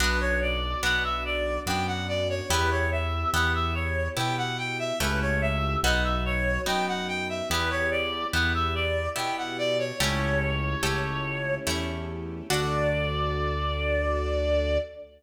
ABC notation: X:1
M:3/4
L:1/16
Q:1/4=72
K:D
V:1 name="Clarinet"
B c d2 f e d2 g f d c | B c e2 f e c2 g f g e | B c e2 f e c2 g f g e | B c d2 f e d2 g f d c |
c8 z4 | d12 |]
V:2 name="Orchestral Harp"
[B,DF]4 [B,DF]4 [B,DF]4 | [B,EG]4 [B,EG]4 [B,EG]4 | [A,CEG]4 [B,^DF]4 [B,DF]4 | [B,EG]4 [B,EG]4 [B,EG]4 |
[A,CEG]4 [A,CEG]4 [A,CEG]4 | [DFA]12 |]
V:3 name="String Ensemble 1"
[B,DF]12 | [B,EG]12 | [A,CEG]4 [B,^DF]8 | [B,EG]12 |
[A,CEG]12 | [DFA]12 |]
V:4 name="Acoustic Grand Piano" clef=bass
B,,,4 B,,,4 F,,4 | E,,4 E,,4 B,,4 | C,,4 B,,,4 F,,4 | E,,4 E,,4 B,,4 |
C,,4 C,,4 E,,4 | D,,12 |]